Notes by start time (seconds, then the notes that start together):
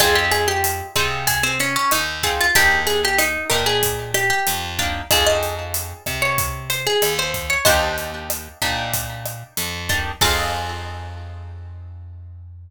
0.00 F2 C4 D#4 F4 G#4, kick, cross-stick, closed hi-hat
0.15 G4
0.32 G#4, closed hi-hat
0.48 G4
0.64 closed hi-hat
0.96 C3 C4 D#4 F4 G#4, kick, cross-stick, closed hi-hat
1.27 G#4, kick, closed hi-hat
1.43 C4
1.60 C#4, closed hi-hat
1.76 C#4
1.91 D#2 D#4, cross-stick, closed hi-hat
2.23 C4 D#4 F4 G#4, kick, closed hi-hat
2.41 F4
2.55 D#2 A#3 D4 D#4 G4, kick, closed hi-hat
2.87 G#4, closed hi-hat
3.05 G4
3.18 D#4, cross-stick, closed hi-hat
3.50 A#2 A#3 D4 D#4 G4 A#4, kick, closed hi-hat
3.66 G#4
3.83 kick, closed hi-hat
4.14 G4, cross-stick, closed hi-hat
4.30 G4
4.47 F2, closed hi-hat
4.79 A#3 D4 D#4 G4, kick, closed hi-hat
5.11 F2 C4 D#4 F4 G#4, kick, cross-stick, closed hi-hat
5.26 D#5
5.43 closed hi-hat
5.74 closed hi-hat
6.06 C3, kick, cross-stick, closed hi-hat
6.22 C#5
6.38 kick, closed hi-hat
6.70 C5, closed hi-hat
6.87 G#4
7.02 D#2, cross-stick, closed hi-hat
7.19 C5
7.34 kick, closed hi-hat
7.50 C#5
7.65 D#2 A#3 D4 D#4 G4 C5 D#5, kick, closed hi-hat
7.98 closed hi-hat
8.30 cross-stick, closed hi-hat
8.62 A#2 A#3 D4 D#4 G4, kick, closed hi-hat
8.94 kick, closed hi-hat
9.26 cross-stick, closed hi-hat
9.57 F2, closed hi-hat
9.89 A#3 D4 D#4 G4, kick, closed hi-hat
10.21 F2 C4 D#4 F4 G#4 F5, kick, crash